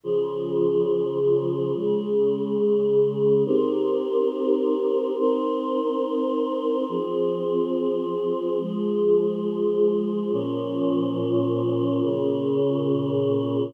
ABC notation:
X:1
M:4/4
L:1/8
Q:1/4=70
K:Fm
V:1 name="Choir Aahs"
[D,F,A]4 [D,A,A]4 | [CEGB]4 [CEBc]4 | [F,CA]4 [F,A,A]4 | [B,,F,D]4 [B,,D,D]4 |]